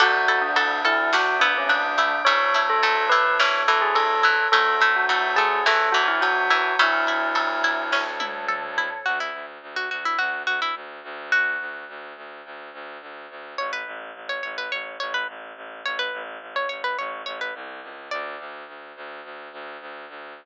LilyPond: <<
  \new Staff \with { instrumentName = "Tubular Bells" } { \time 4/4 \key d \lydian \tempo 4 = 106 fis'8. d'8. e'8 fis'8 d'16 cis'16 d'4 | cis''8. a'8. b'8 cis''8 a'16 gis'16 a'4 | a'8. fis'8. gis'8 a'8 fis'16 e'16 fis'4 | e'2~ e'8 r4. |
r1 | r1 | r1 | r1 |
r1 | }
  \new Staff \with { instrumentName = "Pizzicato Strings" } { \time 4/4 \key d \lydian a'8 a'8 a'8 a'8 d'8 b4 a8 | a8 a8 a8 a8 e8 e4 e8 | a8 a8 a8 a8 e8 e4 e8 | a4. r2 r8 |
fis'16 e'8 r8 fis'16 fis'16 e'16 fis'8 fis'16 e'16 r4 | fis'4. r2 r8 | cis''16 b'8 r8 cis''16 cis''16 b'16 cis''8 cis''16 b'16 r4 | cis''16 b'8 r8 cis''16 cis''16 b'16 cis''8 cis''16 b'16 r4 |
d''4. r2 r8 | }
  \new Staff \with { instrumentName = "Pizzicato Strings" } { \time 4/4 \key d \lydian d'8 e'8 fis'8 a'8 fis'8 e'8 d'8 e'8 | cis'8 e'8 a'8 e'8 cis'8 e'8 a'8 e'8 | cis'8 e'8 fis'8 a'8 fis'8 e'8 cis'8 e'8 | cis'8 e'8 a'8 e'8 cis'8 e'8 a'8 e'8 |
r1 | r1 | r1 | r1 |
r1 | }
  \new Staff \with { instrumentName = "Violin" } { \clef bass \time 4/4 \key d \lydian d,1 | d,1 | d,1 | d,1 |
d,8 d,8 d,8 d,8 d,8 d,8 d,8 d,8~ | d,8 d,8 d,8 d,8 d,8 d,8 d,8 d,8 | a,,8 a,,8 a,,8 a,,8 a,,8 a,,8 a,,8 a,,8 | a,,8 a,,8 a,,8 a,,8 a,,8 a,,8 c,8 cis,8 |
d,8 d,8 d,8 d,8 d,8 d,8 d,8 d,8 | }
  \new Staff \with { instrumentName = "Choir Aahs" } { \time 4/4 \key d \lydian <d'' e'' fis'' a''>2 <d'' e'' a'' d'''>2 | <cis'' e'' a''>2 <a' cis'' a''>2 | <cis'' e'' fis'' a''>2 <cis'' e'' a'' cis'''>2 | <cis'' e'' a''>2 <a' cis'' a''>2 |
r1 | r1 | r1 | r1 |
r1 | }
  \new DrumStaff \with { instrumentName = "Drums" } \drummode { \time 4/4 <cymc bd>8 cymr8 cymr8 cymr8 sn8 cymr8 cymr8 cymr8 | <bd cymr>8 cymr8 cymr8 cymr8 sn8 cymr8 cymr8 cymr8 | <bd cymr>8 <bd cymr>8 cymr8 cymr8 sn8 cymr8 cymr8 cymr8 | <bd cymr>8 cymr8 cymr8 cymr8 <bd sn>8 tommh8 toml8 tomfh8 |
r4 r4 r4 r4 | r4 r4 r4 r4 | r4 r4 r4 r4 | r4 r4 r4 r4 |
r4 r4 r4 r4 | }
>>